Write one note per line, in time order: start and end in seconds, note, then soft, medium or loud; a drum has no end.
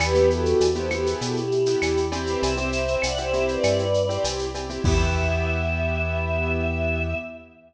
0.00 0.54 E2 medium
0.00 0.12 B3 loud
0.00 0.12 E4 loud
0.00 0.29 G4 loud
0.00 0.12 G4 medium
0.00 0.29 B4 loud
0.00 cowbell loud
0.00 claves loud
0.00 shaker loud
0.15 0.64 B3 medium
0.15 0.64 E4 medium
0.15 0.64 G4 medium
0.15 shaker medium
0.30 0.68 F#4 medium
0.30 0.68 A4 medium
0.30 shaker medium
0.46 shaker medium
0.60 1.15 E2 medium
0.60 cowbell medium
0.60 shaker loud
0.75 0.88 B3 medium
0.75 0.88 E4 medium
0.75 0.88 G4 medium
0.75 0.90 A4 medium
0.75 0.90 C5 medium
0.75 shaker medium
0.90 1.40 B3 medium
0.90 1.40 E4 medium
0.90 1.40 G4 medium
0.90 1.07 G4 medium
0.90 1.07 B4 loud
0.90 claves loud
0.90 shaker medium
1.06 1.20 G#4 loud
1.06 shaker loud
1.21 1.76 B2 medium
1.21 1.36 F#4 medium
1.21 1.36 A4 medium
1.21 cowbell medium
1.21 shaker loud
1.36 1.99 E4 medium
1.36 1.99 G4 medium
1.36 shaker medium
1.52 shaker medium
1.66 2.03 B3 medium
1.66 2.03 E4 medium
1.66 2.03 G4 medium
1.66 shaker loud
1.82 2.36 E2 medium
1.82 cowbell medium
1.82 claves loud
1.82 shaker loud
1.97 shaker medium
2.12 2.55 C4 loud
2.12 2.26 E4 medium
2.12 2.55 E4 loud
2.12 2.26 G4 medium
2.12 2.55 G4 loud
2.12 cowbell loud
2.12 shaker loud
2.27 2.42 G4 medium
2.27 2.42 B4 loud
2.27 shaker medium
2.42 2.97 C2 medium
2.42 2.95 C5 medium
2.42 2.95 E5 loud
2.42 cowbell loud
2.42 shaker loud
2.57 3.06 C4 loud
2.57 3.06 E4 medium
2.57 3.06 G4 medium
2.57 shaker medium
2.72 shaker loud
2.88 shaker medium
3.02 3.58 C2 medium
3.02 3.17 D5 medium
3.02 3.17 F#5 medium
3.02 cowbell medium
3.02 claves loud
3.02 shaker loud
3.17 3.30 C4 medium
3.17 3.30 E4 medium
3.17 3.30 G4 medium
3.17 3.46 C5 medium
3.17 3.46 E5 medium
3.17 shaker medium
3.33 3.82 C4 medium
3.33 3.82 E4 medium
3.33 3.82 G4 medium
3.33 shaker medium
3.48 4.17 B4 medium
3.48 4.17 D5 medium
3.48 shaker medium
3.63 4.18 G2 medium
3.63 cowbell loud
3.63 claves loud
3.63 shaker loud
3.79 shaker medium
3.94 shaker medium
4.09 4.45 C4 medium
4.09 4.45 E4 medium
4.09 4.45 G4 medium
4.09 shaker medium
4.24 4.79 C2 medium
4.24 cowbell medium
4.24 shaker loud
4.39 shaker medium
4.55 4.67 C4 medium
4.55 4.67 E4 medium
4.55 4.67 G4 medium
4.55 cowbell medium
4.55 shaker medium
4.70 4.82 C4 medium
4.70 4.82 E4 medium
4.70 4.82 G4 medium
4.70 shaker medium
4.84 7.14 E2 loud
4.84 7.14 B3 loud
4.84 7.14 E4 loud
4.84 7.14 G4 medium
4.84 7.15 E5 loud
4.84 kick loud
4.84 crash loud